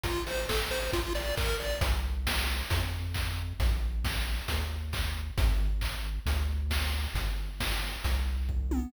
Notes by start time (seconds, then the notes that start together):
0.04 A1 F4, kick, closed hi-hat
0.26 A1 C5, open hi-hat
0.49 A1 A4, kick, snare
0.70 A1 C5, open hi-hat
0.93 A#1 F4, kick, closed hi-hat
1.14 A#1 D5, open hi-hat
1.37 A#1 A#4, kick, clap
1.60 A#1 D5, open hi-hat
1.81 C2, kick, closed hi-hat
2.27 kick, snare
2.70 F2, kick, closed hi-hat
3.14 kick, clap
3.60 A#1, kick, closed hi-hat
4.04 kick, snare
4.48 D#2, kick, closed hi-hat
4.93 kick, clap
5.38 G#1, kick, closed hi-hat
5.81 kick, clap
6.26 D2, kick, closed hi-hat
6.70 kick, snare
7.14 G1, kick, closed hi-hat
7.60 kick, snare
8.04 C2, kick, closed hi-hat
8.49 kick
8.71 high tom